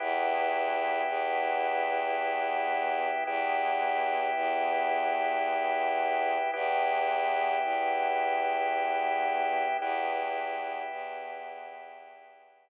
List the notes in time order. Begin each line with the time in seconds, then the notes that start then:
0.00 E2 B3 E4 G4
1.08 E2
3.27 E2 B3 E4 G4
4.36 E2
6.53 E2 B3 E4 G4
7.64 E2
9.81 E2 B3 E4 G4
10.92 E2